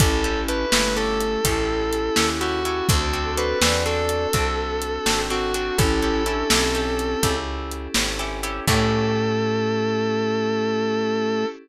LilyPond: <<
  \new Staff \with { instrumentName = "Distortion Guitar" } { \time 12/8 \key a \major \tempo 4. = 83 a'4 b'4 a'2. fis'4 | a'4 b'4 a'2. fis'4 | a'2.~ a'8 r2 r8 | a'1. | }
  \new Staff \with { instrumentName = "Ocarina" } { \time 12/8 \key a \major <cis' e'>4. a4. e'2. | <fis' a'>4. d''4. a'2. | <cis' e'>4 d'8 c'2 r2 r8 | a1. | }
  \new Staff \with { instrumentName = "Acoustic Guitar (steel)" } { \time 12/8 \key a \major <cis' e' g' a'>8 <cis' e' g' a'>8 <cis' e' g' a'>8 <cis' e' g' a'>8 <cis' e' g' a'>4 <cis' e' g' a'>4. <cis' e' g' a'>8 <cis' e' g' a'>8 <cis' e' g' a'>8 | <c' d' fis' a'>8 <c' d' fis' a'>8 <c' d' fis' a'>8 <c' d' fis' a'>8 <c' d' fis' a'>4 <c' d' fis' a'>4. <c' d' fis' a'>8 <c' d' fis' a'>8 <c' d' fis' a'>8 | <cis' e' g' a'>8 <cis' e' g' a'>8 <cis' e' g' a'>8 <cis' e' g' a'>8 <cis' e' g' a'>4 <cis' e' g' a'>4. <cis' e' g' a'>8 <cis' e' g' a'>8 <cis' e' g' a'>8 | <cis' e' g' a'>1. | }
  \new Staff \with { instrumentName = "Electric Bass (finger)" } { \clef bass \time 12/8 \key a \major a,,4. g,,4. a,,4. dis,4. | d,4. e,4. c,4. gis,,4. | a,,4. b,,4. cis,4. gis,,4. | a,1. | }
  \new Staff \with { instrumentName = "Pad 5 (bowed)" } { \time 12/8 \key a \major <cis' e' g' a'>1. | <c' d' fis' a'>1. | <cis' e' g' a'>1. | <cis' e' g' a'>1. | }
  \new DrumStaff \with { instrumentName = "Drums" } \drummode { \time 12/8 <hh bd>4 hh8 sn4 hh8 <hh bd>4 hh8 sn4 hh8 | <hh bd>4 hh8 sn4 hh8 <hh bd>4 hh8 sn4 hh8 | <hh bd>4 hh8 sn4 hh8 <hh bd>4 hh8 sn4 hh8 | <cymc bd>4. r4. r4. r4. | }
>>